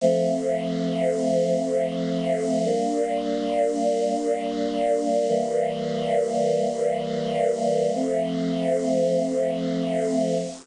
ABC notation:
X:1
M:3/4
L:1/8
Q:1/4=68
K:F
V:1 name="Choir Aahs"
[F,A,C]6 | [G,B,D]6 | [E,G,B,]6 | [F,A,C]6 |]